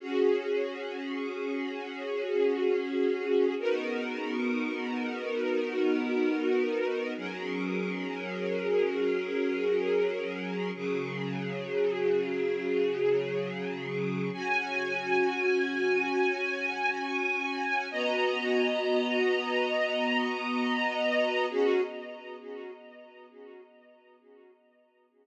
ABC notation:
X:1
M:4/4
L:1/8
Q:1/4=67
K:Db
V:1 name="String Ensemble 1"
[DGA]8 | [_CEGB]8 | [G,DAB]8 | [D,G,A]8 |
[DGa]8 | [_CGeb]8 | [DGA]2 z6 |]